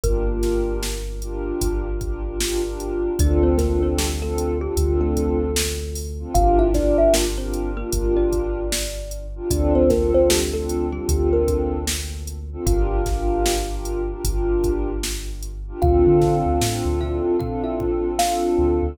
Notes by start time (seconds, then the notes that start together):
0.03 G1 A#3 D4 F4 G4 A#4, kick, closed hi-hat
0.26 D4 F4 G4 A#4
0.43 snare, closed hi-hat
0.83 snare
1.21 D4 F4 G4 A#4, closed hi-hat
1.61 G1, kick, closed hi-hat
2.01 D4 F4 G4 A#4, kick, closed hi-hat
2.25 D4 F4 G4 A#4
2.40 D4 F4 G4 A#4, snare
2.63 D4 F4 G4 A#4
2.80 closed hi-hat
3.19 D2 C4 D4 F4 A4 D5, kick, closed hi-hat
3.43 C4 C5
3.58 A#3 C4 D4 F4 A4 A#4, kick, snare, closed hi-hat
3.83 C4 C5
3.98 G3 G4, snare
4.21 A3 C4 D4 F4 A4
4.38 closed hi-hat
4.61 G3 C4 D4 F4 G4 A4
4.77 D2 C4 D4 F4 A4, kick, closed hi-hat
5.01 A3 A4
5.17 kick, closed hi-hat
5.56 snare
5.95 open hi-hat
6.19 C4 D4 F4 A4
6.34 G1 D4 F4 G4 A#4 F5, kick, closed hi-hat
6.59 E4 E5
6.74 D4 F4 G4 A#4 D5, kick, snare, closed hi-hat
6.98 E4 E5
7.14 A#3 A#4, snare
7.38 C4 D4 F4 G4 A#4 C5
7.53 closed hi-hat
7.77 A#3 D4 F4 G4 A#4
7.92 G1 D4 F4 G4 A#4, kick, closed hi-hat
8.16 D4 D5
8.32 kick, closed hi-hat
8.72 snare
9.11 closed hi-hat
9.36 D4 F4 G4 A#4
9.50 D2 C4 D4 F4 A4 D5, kick, closed hi-hat
9.75 C4 C5
9.89 A#3 C4 D4 F4 A4 A#4, kick, snare, closed hi-hat
10.14 C4 C5
10.30 G3 G4, snare
10.53 A3 C4 D4 F4 A4
10.69 closed hi-hat
10.92 G3 C4 D4 F4 G4 A4
11.09 D2 C4 D4 F4 A4, kick, closed hi-hat
11.33 A#3 A#4
11.48 kick, closed hi-hat
11.87 snare
12.27 closed hi-hat
12.52 C4 D4 F4 A4
12.66 G1 D4 F4 G4 A#4 F5, kick, closed hi-hat
13.06 D4 F4 G4 A#4, kick, snare, closed hi-hat
13.46 snare
13.70 D4 F4 G4 A#4
13.85 closed hi-hat
14.09 D4 F4 G4 A#4
14.24 G1 D4 F4 G4 A#4, kick, closed hi-hat
14.64 kick, closed hi-hat
15.03 snare
15.42 closed hi-hat
15.67 D4 F4 G4 A#4
15.82 D2 C4 D4 F4 A4 F5, kick, floor tom
16.07 D3
16.22 kick, snare, floor tom
16.46 D2
16.61 A2 C4 D4 F4 A4, snare
16.85 D2
17.00 E4 E5, floor tom
17.39 C4 D4 F4 A4 F5, kick, floor tom
17.64 E4 E5
17.80 kick, floor tom
18.19 C4 D4 F4 A4 F5, snare
18.58 D2, floor tom
18.83 D2